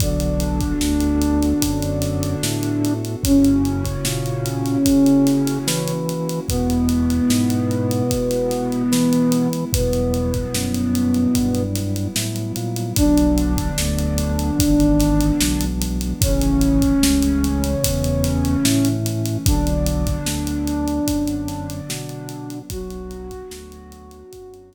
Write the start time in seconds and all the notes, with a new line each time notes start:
0.00 B1 D3 B3 D4 F#4 A4, kick, closed hi-hat
0.20 closed hi-hat
0.40 closed hi-hat
0.60 kick, closed hi-hat
0.81 D2, snare
1.00 closed hi-hat
1.21 closed hi-hat
1.43 snare, closed hi-hat
1.62 F#2, kick, closed hi-hat
1.82 closed hi-hat
2.02 snare, closed hi-hat
2.23 closed hi-hat
2.43 A2, snare
2.63 closed hi-hat
2.85 closed hi-hat
3.05 closed hi-hat
3.22 F#2 C#3 A#3 C#4 E4 F#4, kick, closed hi-hat
3.44 closed hi-hat
3.65 closed hi-hat
3.85 kick, closed hi-hat
4.05 A#2, snare
4.26 closed hi-hat
4.46 closed hi-hat
4.66 snare, closed hi-hat
4.85 C#3, kick, closed hi-hat
5.06 closed hi-hat
5.27 snare, closed hi-hat
5.47 snare, closed hi-hat
5.67 E3, snare
5.88 closed hi-hat
6.09 closed hi-hat
6.29 closed hi-hat
6.47 E2 B2 G#3 B3 E4, kick, closed hi-hat
6.70 closed hi-hat
6.89 snare, closed hi-hat
7.10 closed hi-hat
7.30 G#2, snare
7.50 closed hi-hat
7.71 closed hi-hat
7.91 closed hi-hat
8.11 B2, kick, closed hi-hat
8.31 snare, closed hi-hat
8.51 snare, closed hi-hat
8.72 closed hi-hat
8.92 E3, snare
9.13 closed hi-hat
9.32 closed hi-hat
9.53 closed hi-hat
9.72 E2 B2 F#3 G3 B3 E4, kick, closed hi-hat
9.93 snare, closed hi-hat
10.14 closed hi-hat
10.34 kick, closed hi-hat
10.54 F#2, snare
10.74 closed hi-hat
10.95 closed hi-hat
11.14 closed hi-hat
11.35 G2, kick, closed hi-hat
11.55 closed hi-hat
11.76 snare, closed hi-hat
11.96 closed hi-hat
12.16 A2, snare
12.36 closed hi-hat
12.56 A#2, closed hi-hat
12.76 closed hi-hat
12.96 B1 D3 F#3 B3 D4, kick, closed hi-hat
13.18 closed hi-hat
13.38 closed hi-hat
13.57 kick, closed hi-hat
13.78 D2, snare
13.98 closed hi-hat
14.18 closed hi-hat
14.39 closed hi-hat
14.59 G#1 E3 G#3 B3 D4, kick, closed hi-hat
14.80 closed hi-hat
14.99 snare, closed hi-hat
15.20 closed hi-hat
15.41 B1, snare
15.61 closed hi-hat
15.82 closed hi-hat
16.01 closed hi-hat
16.21 A1 C#3 E3 A3 C#4, kick, closed hi-hat
16.41 snare, closed hi-hat
16.61 closed hi-hat
16.82 kick, closed hi-hat
17.03 C#2, snare
17.22 closed hi-hat
17.44 closed hi-hat
17.64 closed hi-hat
17.84 E2, kick, closed hi-hat
18.04 closed hi-hat
18.24 snare, closed hi-hat
18.45 closed hi-hat
18.65 A2, snare
18.85 closed hi-hat
19.06 closed hi-hat
19.26 closed hi-hat
19.45 B1 D3 F#3 B3 D4, kick, closed hi-hat
19.67 closed hi-hat
19.86 closed hi-hat
20.07 kick, closed hi-hat
20.26 D2, snare
20.47 closed hi-hat
20.67 closed hi-hat
20.88 closed hi-hat
21.08 F#2, kick, closed hi-hat
21.27 closed hi-hat
21.48 snare, closed hi-hat
21.70 closed hi-hat
21.89 B2, snare
22.09 closed hi-hat
22.29 closed hi-hat
22.50 closed hi-hat
22.70 B1 F#3 B3 D4 F#4, kick, closed hi-hat
22.90 closed hi-hat
23.11 closed hi-hat
23.31 kick, closed hi-hat
23.51 D2, snare
23.72 closed hi-hat
23.92 closed hi-hat
24.11 closed hi-hat
24.33 F#2, kick, closed hi-hat
24.54 closed hi-hat
24.73 snare, closed hi-hat